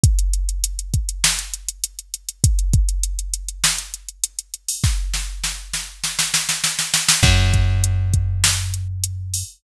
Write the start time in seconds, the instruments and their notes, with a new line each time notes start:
0.04 kick, closed hi-hat
0.19 closed hi-hat
0.33 closed hi-hat
0.49 closed hi-hat
0.64 closed hi-hat
0.79 closed hi-hat
0.94 kick, closed hi-hat
1.09 closed hi-hat
1.24 snare
1.39 closed hi-hat
1.54 closed hi-hat
1.69 closed hi-hat
1.84 closed hi-hat
1.99 closed hi-hat
2.14 closed hi-hat
2.29 closed hi-hat
2.44 kick, closed hi-hat
2.59 closed hi-hat
2.73 kick, closed hi-hat
2.89 closed hi-hat
3.03 closed hi-hat
3.19 closed hi-hat
3.33 closed hi-hat
3.48 closed hi-hat
3.64 snare
3.78 closed hi-hat
3.94 closed hi-hat
4.08 closed hi-hat
4.24 closed hi-hat
4.39 closed hi-hat
4.54 closed hi-hat
4.68 open hi-hat
4.84 kick, snare
5.13 snare
5.44 snare
5.73 snare
6.04 snare
6.19 snare
6.34 snare
6.49 snare
6.64 snare
6.79 snare
6.94 snare
7.08 snare
7.23 electric bass (finger) F#2, kick, crash
7.54 kick, closed hi-hat
7.84 closed hi-hat
8.13 kick, closed hi-hat
8.44 snare
8.74 closed hi-hat
9.04 closed hi-hat
9.34 open hi-hat